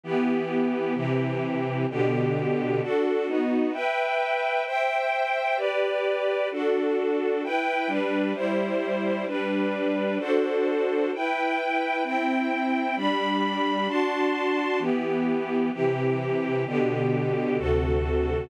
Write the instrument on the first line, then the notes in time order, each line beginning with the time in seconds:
string ensemble 1
0.04 E3 B3 G4
0.94 C3 E3 G4
1.90 B2 D3 G4
2.82 D4 F#4 A4
3.27 B3 D#4 F#4
3.73 B4 E5 G5
4.66 C5 E5 G5
5.57 G4 B4 D5
6.51 D4 F#4 A4
7.44 E4 B4 G5
7.87 G3 D4 B4
8.34 G3 E4 C5
9.27 G3 D4 B4
10.19 D4 F#4 A4 C5
11.13 E4 B4 G5
12.04 C4 E4 G5
12.96 G3 D4 B5
13.88 D4 F#4 A5 C6
14.79 E3 B3 G4
15.73 C3 E3 G4
16.66 B2 D3 G4
17.58 D2 C3 F#4 A4